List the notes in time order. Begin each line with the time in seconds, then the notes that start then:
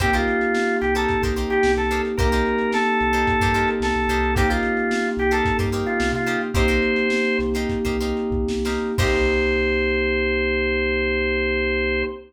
0.00 C2 A#3 C4 D#4 G4 A#4 C5, kick, closed hi-hat
0.13 D#4 F4 G4 A#4 C5, closed hi-hat
0.28 closed hi-hat
0.41 closed hi-hat
0.55 snare
0.69 closed hi-hat
0.81 C2 G4, closed hi-hat
0.95 D#4 G4 A4 A#4 C5, closed hi-hat
1.09 kick, closed hi-hat
1.22 C2 D#4 G4 A#4 C5, kick, closed hi-hat
1.36 D#4 G4 A#4 C5, closed hi-hat
1.50 G4, closed hi-hat
1.63 C2, snare
1.77 C2 A4, closed hi-hat
1.91 D#4 G4 A#4 C5, closed hi-hat
2.05 closed hi-hat
2.18 C2 A#3 C4 D#4 G4 A#4 C5, kick, closed hi-hat
2.32 D#4 G4 A#4 C5, closed hi-hat
2.46 closed hi-hat
2.58 closed hi-hat
2.72 A4, snare
2.86 closed hi-hat
3.00 C2, closed hi-hat
3.13 D#4 G4 A#4 C5, closed hi-hat
3.27 kick, closed hi-hat
3.40 G2 D#4 G4 A#4 C5, kick, snare, closed hi-hat
3.54 D#4 G4 A#4 C5, closed hi-hat
3.68 closed hi-hat
3.80 C2 A4, snare
3.95 C2, closed hi-hat
4.08 C2 D#4 G4 A#4 C5, closed hi-hat
4.23 closed hi-hat
4.35 A#3 C4 D#4 G4 A#4 C5, kick, closed hi-hat
4.49 D#4 F4 G4 A#4 C5, closed hi-hat
4.63 closed hi-hat
4.77 closed hi-hat
4.91 snare
5.05 closed hi-hat
5.17 C2 G4, closed hi-hat
5.31 D#4 G4 A4 A#4 C5, closed hi-hat
5.45 kick, closed hi-hat
5.58 G2 D#4 G4 A#4 C5, kick, snare, closed hi-hat
5.72 D#4 G4 A#4 C5, closed hi-hat
5.86 F4, closed hi-hat
6.00 C2, snare
6.12 C3 F4, closed hi-hat
6.26 D#4 G4 A#4 C5, closed hi-hat
6.41 closed hi-hat
6.54 C2 A#3 C4 D#4 G4 A#4 C5, kick, closed hi-hat
6.68 D#4 G4 A#4 C5, closed hi-hat
6.82 closed hi-hat
6.96 closed hi-hat
7.10 snare
7.25 closed hi-hat
7.39 C2, snare, closed hi-hat
7.54 D#4 G4 A#4 C5, closed hi-hat
7.69 kick, closed hi-hat
7.85 C2 D#4 G4 A#4 C5, kick, closed hi-hat
8.00 D#4 G4 A#4 C5, closed hi-hat
8.17 closed hi-hat
8.31 C2, kick
8.48 C2, snare
8.65 D#4 G4 A#4 C5, snare
8.98 C2 A#3 C4 D#4 G4 A#4 C5, kick, crash